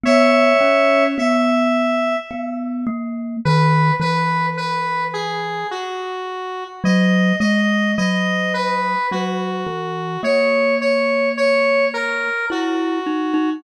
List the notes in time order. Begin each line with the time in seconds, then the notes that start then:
0.03 B3 C#5 E5
0.61 C#4
1.18 B3 E5
2.31 B3
2.87 A#3
3.45 D#3 B4
4.00 E3 B4
4.57 B4
5.13 G#4
5.71 F#4
6.84 F#3 D#5
7.40 G#3 D#5
7.98 F#3 D#5
8.54 B4
9.11 F#3 F#4
9.67 E3
10.23 A#3 C#5
10.81 C#5
11.37 C#5
11.94 A#4
12.50 E4 F#4
13.06 D#4
13.34 D#4